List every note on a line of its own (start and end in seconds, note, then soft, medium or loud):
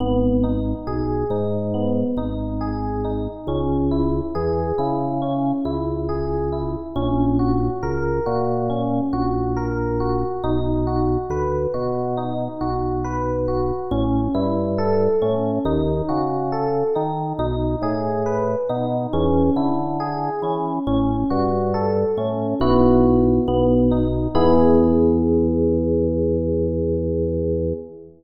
0.00 0.74 G#1 loud
0.00 0.39 B3 medium
0.43 0.83 D#4 medium
0.87 1.24 B1 medium
0.87 1.26 G#4 medium
1.30 2.04 G#2 loud
1.30 1.70 D#4 medium
1.74 2.13 B3 medium
2.17 3.28 G#1 medium
2.17 2.57 D#4 medium
2.61 3.00 G#4 medium
3.05 3.44 D#4 medium
3.47 4.21 C#2 loud
3.47 3.87 C#4 medium
3.91 4.30 E4 medium
4.35 4.72 E2 loud
4.35 4.74 G#4 medium
4.78 5.53 C#3 medium
4.78 5.17 E4 medium
5.22 5.61 C#4 medium
5.65 6.76 C#2 medium
5.65 6.04 E4 medium
6.09 6.48 G#4 medium
6.52 6.91 E4 medium
6.96 7.70 A#1 loud
6.96 7.35 C#4 loud
7.39 7.78 F#4 medium
7.83 8.20 C#2 loud
7.83 8.22 A#4 medium
8.26 9.01 A#2 medium
8.26 8.65 F#4 medium
8.70 9.09 C#4 medium
9.13 10.24 A#1 medium
9.13 9.52 F#4 medium
9.57 9.96 A#4 medium
10.00 10.39 F#4 medium
10.44 11.18 B1 loud
10.44 10.83 D#4 loud
10.87 11.26 F#4 medium
11.30 11.67 D2 loud
11.30 11.70 B4 medium
11.74 12.48 B2 medium
11.74 12.13 F#4 medium
12.17 12.57 D#4 medium
12.61 13.72 B1 medium
12.61 13.00 F#4 medium
13.04 13.43 B4 medium
13.48 13.87 F#4 medium
13.91 14.28 A1 loud
13.91 14.30 C#4 medium
14.34 15.08 G2 loud
14.34 14.74 E4 medium
14.78 15.17 A4 medium
15.22 15.59 A2 medium
15.22 15.61 C#4 medium
15.65 16.02 D#2 loud
15.65 16.05 D#4 loud
16.09 16.84 C#3 medium
16.09 16.48 F#4 medium
16.52 16.91 A4 medium
16.95 17.33 D#3 medium
16.95 17.35 D#4 medium
17.39 17.76 B1 loud
17.39 17.78 D#4 loud
17.82 18.56 A2 medium
17.82 18.22 G#4 medium
18.26 18.65 B4 medium
18.69 19.07 B2 loud
18.69 19.09 D#4 medium
19.13 19.50 E2 loud
19.13 19.52 C#4 loud
19.56 20.30 D3 medium
19.56 19.96 E4 medium
20.00 20.39 G#4 medium
20.42 20.79 E3 medium
20.42 20.83 C#4 medium
20.87 21.24 A1 loud
20.87 21.26 C#4 loud
21.30 22.05 G2 loud
21.30 21.69 F#4 medium
21.74 22.13 A4 medium
22.17 22.54 A2 medium
22.17 22.57 C#4 medium
22.60 23.40 B1 loud
22.60 23.39 B3 loud
22.60 23.39 E4 medium
22.60 23.39 F#4 medium
23.47 24.28 B1 loud
23.47 23.87 B3 loud
23.91 24.31 D#4 medium
24.35 27.73 E2 loud
24.35 27.73 B3 loud
24.35 27.73 E4 loud
24.35 27.73 G#4 medium